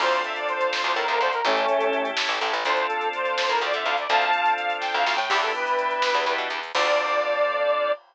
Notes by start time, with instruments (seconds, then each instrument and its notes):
0.00 electric bass (finger) D2, drawbar organ C4 D4 F4 A4, lead 1 (square) C5, kick, crash
0.12 closed hi-hat
0.24 lead 1 (square) E5, closed hi-hat
0.36 lead 1 (square) D5, closed hi-hat
0.48 lead 1 (square) C5, closed hi-hat
0.61 closed hi-hat
0.70 lead 1 (square) C5, snare
0.83 electric bass (finger) D2, lead 1 (square) C5, closed hi-hat
0.95 electric bass (finger) A2, lead 1 (square) A#4, closed hi-hat
1.08 electric bass (finger) D2, lead 1 (square) A#4, closed hi-hat
1.20 electric bass (finger) D2, lead 1 (square) C5, closed hi-hat
1.32 lead 1 (square) A#4, closed hi-hat
1.45 electric bass (finger) A1, lead 1 (square) A3 C#4, drawbar organ C#4 E4 G4 A4, kick, closed hi-hat
1.57 closed hi-hat
1.68 closed hi-hat
1.81 closed hi-hat
1.93 closed hi-hat
2.05 closed hi-hat
2.17 snare
2.29 electric bass (finger) A1, closed hi-hat
2.41 electric bass (finger) A1, closed hi-hat
2.53 electric bass (finger) A1, closed hi-hat
2.65 electric bass (finger) D2, drawbar organ C4 D4 F4 A4, lead 1 (square) C5, kick, closed hi-hat
2.77 closed hi-hat
2.87 lead 1 (square) A4, closed hi-hat
3.01 closed hi-hat
3.13 lead 1 (square) C5, closed hi-hat
3.25 closed hi-hat
3.38 snare
3.49 electric bass (finger) A2, lead 1 (square) A#4, closed hi-hat
3.61 electric bass (finger) D2, lead 1 (square) D5, closed hi-hat
3.73 electric bass (finger) D3, lead 1 (square) E5, closed hi-hat
3.85 electric bass (finger) D2, lead 1 (square) F5, closed hi-hat
3.98 lead 1 (square) D5, closed hi-hat
4.09 electric bass (finger) D2, drawbar organ C4 D4 F4 A4, lead 1 (square) F5 A5, kick, closed hi-hat
4.22 closed hi-hat
4.33 closed hi-hat
4.45 closed hi-hat
4.56 lead 1 (square) F5, closed hi-hat
4.70 closed hi-hat
4.80 lead 1 (square) G5, kick, snare
4.94 electric bass (finger) D2, lead 1 (square) F5
5.06 electric bass (finger) D2, snare
5.15 electric bass (finger) A2, lead 1 (square) G5
5.29 electric bass (finger) E2, drawbar organ B3 D4 E4 G4, lead 1 (square) G4, kick, crash
5.41 lead 1 (square) A4, closed hi-hat
5.55 lead 1 (square) B4, closed hi-hat
5.67 closed hi-hat
5.79 closed hi-hat
5.91 closed hi-hat
6.02 snare
6.14 electric bass (finger) E2, closed hi-hat
6.26 electric bass (finger) E2, closed hi-hat
6.38 electric bass (finger) B2, closed hi-hat
6.50 electric bass (finger) E2, closed hi-hat
6.63 closed hi-hat
6.74 electric bass (finger) D2, drawbar organ C4 D4 F4 A4, lead 1 (square) D5, kick, crash